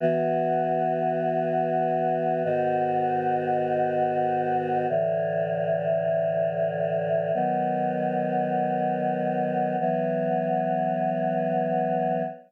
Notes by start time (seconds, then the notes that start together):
0.00 E3 B3 F#4
2.44 G#2 D#3 B3 F#4
4.89 A2 D3 E3
7.34 D#3 F#3 B3
9.80 E3 F#3 B3